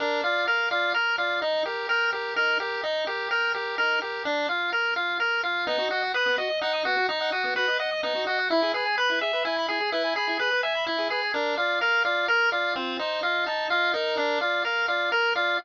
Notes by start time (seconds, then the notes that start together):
0.00 D4 A#4
0.24 F4 D5
0.47 A#4 F5
0.71 F4 D5
0.94 A#4
1.18 F4 D5
1.42 D#4
1.65 G4 A#4
1.89 A#4 G5
2.13 G4 A#4
2.36 D#4 A#4
2.60 G4 A#4
2.83 D#4
3.07 G4 A#4
3.31 A#4 G5
3.54 G4 A#4
3.78 D#4 A#4
4.01 G4 A#4
4.25 D4
4.49 F4
4.72 A#4
4.96 F4
5.20 A#4
5.43 F4
5.67 B3 D#4
5.79 F#4
5.91 F#4 D#5
6.02 F#5
6.14 B4 D#6
6.26 B3
6.38 F#4 D#5
6.50 D#5
6.61 D#4 F#5
6.73 D#6
6.85 B3 F#4
6.97 F#4
7.09 D#4 D#5
7.21 F#5
7.32 F#4 D#6
7.44 B3
7.56 F#4 B4
7.68 D#5
7.79 D#5 F#5
7.91 D#6
8.03 B3 D#4
8.15 F#4
8.27 F#4 D#5
8.39 F#5
8.50 E4
8.62 G#4
8.74 G#4 B4
8.86 G#5
8.98 B4 B5
9.10 E4
9.21 G#4 E5
9.33 B4
9.45 E4 G#5
9.57 B5
9.68 E4 G#4
9.81 G#4
9.92 E4 B4
10.04 G#5
10.16 G#4 B5
10.27 E4
10.39 G#4 B4
10.51 B4
10.63 E5 G#5
10.75 B5
10.87 E4
10.98 G#4
11.10 G#4 B4
11.22 G#5
11.34 D4 A#4
11.57 F4 D5
11.81 A#4 F5
12.05 F4 D5
12.28 A#4
12.52 F4 D5
12.76 C4 F4
12.99 D#4 C5
13.23 F4 D#5
13.46 D#4 A5
13.70 F4 D#5
13.94 D#4 A#4
14.17 D4
14.41 F4 D5
14.64 A#4 F5
14.88 F4 D5
15.12 A#4
15.35 F4 D5